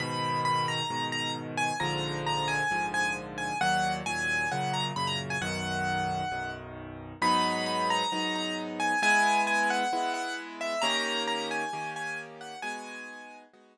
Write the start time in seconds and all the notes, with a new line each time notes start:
0.00 G#2 B2 D#3 B5
0.45 B5
0.68 A#5
0.90 G#2 B2 D#3
1.12 A#5
1.57 G#5
1.80 A#1 G#2 D3 F3 A#5
2.27 A#5
2.48 G#5
2.71 A#1 G#2 D3 F3
2.94 G#5
3.38 G#5
3.61 D#2 A#2 F#3 F#5
4.06 D#2 A#2 F#3 G#5
4.51 F#2 A#2 C#3 F#5
4.73 A#5
4.96 F#2 A#2 C#3 B5
5.07 A#5
5.30 G#5
5.41 B1 F#2 D#3 F#5
6.32 B1 F#2 D#3
7.22 G#2 F#3 B3 D#4 B5
7.66 B5
7.90 A#5
8.12 G#2 F#3 B3 D#4
8.35 A#5
8.80 G#5
9.02 G#3 B3 E4 G#5
9.47 G#5
9.70 F#5
9.93 G#3 B3 E4
10.14 F#5
10.61 E5
10.82 D#3 A#3 C#4 G4 A#5
11.27 A#5
11.51 G#5
11.73 D#3 A#3 C#4 G4
11.96 G#5
12.41 F#5
12.62 G#3 B3 D#4 F#4 G#5
13.53 G#3 B3 D#4 F#4